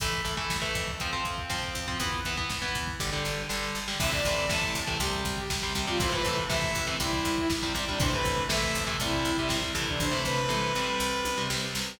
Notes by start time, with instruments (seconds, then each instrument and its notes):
0.00 electric bass (finger) A1, overdriven guitar E3 A3, kick, closed hi-hat
0.12 kick
0.25 electric bass (finger) A1, overdriven guitar E3 A3, kick
0.37 overdriven guitar E3 A3, kick
0.50 electric bass (finger) A1, kick, snare
0.62 overdriven guitar E3 A3, kick
0.75 electric bass (finger) F2, kick
0.88 kick
1.00 overdriven guitar F3 C4, kick, closed hi-hat
1.12 overdriven guitar F3 C4, kick
1.25 electric bass (finger) F2, kick
1.38 kick
1.49 electric bass (finger) F2, overdriven guitar F3 C4, kick, snare
1.63 kick
1.75 electric bass (finger) F2, kick
1.88 overdriven guitar F3 C4, kick
2.00 electric bass (finger) E2, overdriven guitar E3 B3, kick, closed hi-hat
2.12 kick
2.25 electric bass (finger) E2, overdriven guitar E3 B3, kick
2.37 overdriven guitar E3 B3, kick
2.50 electric bass (finger) E2, kick, snare
2.62 overdriven guitar E3 B3, kick
2.75 electric bass (finger) E2, kick
2.87 kick
3.00 electric bass (finger) G1, overdriven guitar D3 G3, kick, snare
3.12 overdriven guitar D3 G3
3.25 electric bass (finger) G1, snare
3.49 electric bass (finger) G1, overdriven guitar D3 G3, snare
3.63 snare
3.75 electric bass (finger) G1, snare
3.88 overdriven guitar D3 G3, snare
3.99 electric bass (finger) A1, overdriven guitar C3 E3 A3, lead 2 (sawtooth) E5, kick, crash
4.11 overdriven guitar C3 E3 A3, lead 2 (sawtooth) D5, kick
4.24 electric bass (finger) A1, overdriven guitar C3 E3 A3, kick, closed hi-hat
4.37 kick
4.49 electric bass (finger) A1, overdriven guitar C3 E3 A3, lead 2 (sawtooth) A5, kick, snare
4.62 kick
4.75 electric bass (finger) A1, kick, closed hi-hat
4.87 overdriven guitar C3 E3 A3, kick
4.99 electric bass (finger) C2, overdriven guitar C3 G3, lead 2 (sawtooth) G4, kick, closed hi-hat
5.13 kick
5.25 electric bass (finger) C2, kick, snare, closed hi-hat
5.37 lead 2 (sawtooth) G4, kick
5.50 electric bass (finger) C2, kick, snare
5.62 overdriven guitar C3 G3, kick
5.75 electric bass (finger) C2, overdriven guitar C3 G3, kick, closed hi-hat
5.87 overdriven guitar C3 G3, lead 2 (sawtooth) F4, kick
6.00 electric bass (finger) A1, overdriven guitar C3 E3 A3, lead 2 (sawtooth) C5, kick, closed hi-hat
6.12 overdriven guitar C3 E3 A3, lead 2 (sawtooth) B4, kick
6.25 electric bass (finger) A1, overdriven guitar C3 E3 A3, kick, closed hi-hat
6.37 kick
6.49 electric bass (finger) A1, overdriven guitar C3 E3 A3, lead 2 (sawtooth) E5, kick, snare
6.62 kick
6.75 electric bass (finger) A1, kick, closed hi-hat
6.87 overdriven guitar C3 E3 A3, kick
7.00 electric bass (finger) C2, overdriven guitar C3 G3, lead 2 (sawtooth) E4, kick, closed hi-hat
7.13 kick
7.25 electric bass (finger) C2, kick, snare, closed hi-hat
7.37 lead 2 (sawtooth) E4, kick
7.50 electric bass (finger) C2, kick, snare
7.62 overdriven guitar C3 G3, kick
7.75 electric bass (finger) C2, overdriven guitar C3 G3, kick, closed hi-hat
7.88 overdriven guitar C3 G3, lead 2 (sawtooth) D4, kick
8.00 electric bass (finger) A1, overdriven guitar C3 E3 A3, lead 2 (sawtooth) C5, kick, closed hi-hat
8.12 overdriven guitar C3 E3 A3, lead 2 (sawtooth) B4, kick
8.25 electric bass (finger) A1, kick, closed hi-hat
8.37 kick
8.49 electric bass (finger) A#1, overdriven guitar C3 E3 A3, lead 2 (sawtooth) E5, kick, snare
8.63 kick
8.75 electric bass (finger) A1, kick, closed hi-hat
8.87 overdriven guitar C3 E3 A3, kick
9.00 electric bass (finger) C2, overdriven guitar C3 G3, lead 2 (sawtooth) E4, kick, closed hi-hat
9.13 kick
9.25 electric bass (finger) C2, kick, snare, closed hi-hat
9.37 overdriven guitar C3 G3, lead 2 (sawtooth) E4, kick
9.49 electric bass (finger) C2, overdriven guitar C3 G3, kick, snare
9.62 kick
9.75 electric bass (finger) C2, overdriven guitar C3 E3 A3, kick, open hi-hat
9.88 lead 2 (sawtooth) D4, kick
10.00 electric bass (finger) A1, lead 2 (sawtooth) C5, kick, floor tom
10.11 overdriven guitar C3 E3 A3
10.24 electric bass (finger) A1, lead 2 (sawtooth) B4, floor tom
10.49 electric bass (finger) A1, overdriven guitar C3 E3 A3, mid tom
10.75 electric bass (finger) A1, overdriven guitar C3 G3
11.00 electric bass (finger) C2
11.25 electric bass (finger) C2, high tom
11.38 overdriven guitar C3 G3
11.50 electric bass (finger) C2, overdriven guitar C3 G3, snare
11.75 electric bass (finger) C2, snare